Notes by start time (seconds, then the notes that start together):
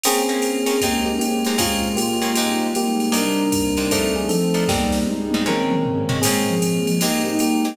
0.03 A#3 C4 C#4 G#4, crash, ride
0.29 A#3 C4 C#4 G#4
0.42 A#3 C4 F4 G#4, hi-hat pedal, ride
0.66 A#3 C4 C#4 G#4, ride
0.81 G#3 A#3 C4 D#4 G4, kick, ride
1.06 A#3 G4
1.19 G#3 A#3 C4 C#4 G4 G#4, hi-hat pedal, ride
1.45 G#3 C4 D#4 G4, ride
1.58 A#2 G#3 A#3 C4 C#4 F4 G#4, kick, ride
1.96 A#2 G#3 A#3 C#4 G4, hi-hat pedal, ride
2.22 A#3 C4 C#4 G#4, ride
2.35 G#2 G3 G#3 C4 D#4 G4, ride
2.75 G#2 G3 G#3 A#3 D#4 G4, hi-hat pedal, ride
3.00 ride
3.12 C3 G3 A#3 D4 D#4, ride
3.16 D4 A#4
3.52 C3 A#3 C4 D#4, kick, hi-hat pedal, ride
3.77 C3 A#3 D4 D#4, ride
3.91 F3 A3 C4 D4 D#4 A4, kick, ride
4.16 G#4
4.29 F3 A3 C4 D#4 A4, hi-hat pedal, ride
4.54 F3 A3 D4 D#4, ride
4.68 G#2 G3 A#3 C4 D#4 G4, kick, snare
4.92 snare
5.07 G#2 G3 G#3 D#4, high tom
5.31 G#2 G3 C4 D#4, high tom
5.46 A#2 G#3 C4 C#4 A#4, mid tom
5.71 mid tom
5.85 A#2 G#3 A#3 C#4, floor tom
6.09 A#2 G#3 C4 C#4, floor tom
6.22 A#2 G#3 A#3 C4 C#4 G#4, crash, ride
6.48 F3
6.62 A#2 G#3 A#3 C#4, hi-hat pedal, ride
6.87 F3, ride
7.01 G#2 G3 G#3 A#3 C4 D#4 G4, ride
7.25 A#3 D#4 G4
7.39 G#2 G3 G#3 A#3 D#4 G4, hi-hat pedal, ride
7.65 G#3 C4 D#4 G4, ride